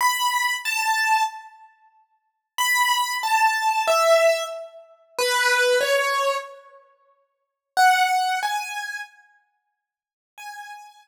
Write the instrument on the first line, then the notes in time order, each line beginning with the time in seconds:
acoustic grand piano
0.01 B5
0.65 A5
2.58 B5
3.23 A5
3.88 E5
5.19 B4
5.81 C#5
7.77 F#5
8.43 G#5
10.38 G#5